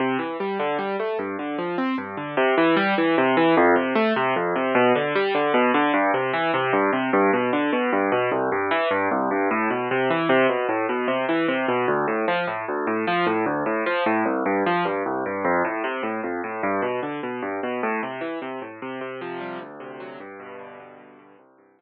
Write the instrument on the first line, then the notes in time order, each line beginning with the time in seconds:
acoustic grand piano
0.00 C3
0.19 E3
0.40 G3
0.59 D3
0.79 G3
1.00 A3
1.19 G2
1.39 D3
1.58 F3
1.78 C4
1.98 G2
2.17 D3
2.37 C3
2.58 E3
2.76 G3
2.98 E3
3.18 C3
3.37 E3
3.57 F2
3.76 C3
3.95 A3
4.16 C3
4.36 F2
4.56 C3
4.75 B2
4.95 D3
5.15 G3
5.35 D3
5.54 B2
5.74 D3
5.94 G2
6.14 C3
6.33 E3
6.54 C3
6.73 G2
6.93 C3
7.13 G2
7.33 B2
7.53 D3
7.73 B2
7.93 G2
8.12 B2
8.32 C2
8.52 G2
8.71 E3
8.91 G2
9.11 C2
9.31 G2
9.51 A2
9.70 B2
9.91 C3
10.10 E3
10.29 C3
10.49 B2
10.69 A2
10.89 B2
11.08 C3
11.29 E3
11.48 C3
11.68 B2
11.88 D2
12.08 A2
12.28 F3
12.47 A2
12.68 D2
12.87 A2
13.07 F3
13.27 A2
13.46 D2
13.66 A2
13.86 F3
14.06 A2
14.26 C2
14.46 G2
14.66 F3
14.85 G2
15.06 C2
15.26 G2
15.45 F2
15.65 A2
15.84 C3
16.03 A2
16.23 F2
16.44 A2
16.63 G2
16.82 B2
17.03 D3
17.23 B2
17.42 G2
17.63 B2
17.83 A2
18.03 C3
18.21 E3
18.42 C3
18.62 A2
18.82 C3
19.01 C3
19.21 F3
19.41 G3
19.61 D2
19.80 C3
20.00 F#3
20.20 G2
20.40 B2
20.59 D3
20.80 B2
20.98 G2
21.19 B2
21.38 C2
21.58 G2
21.79 F3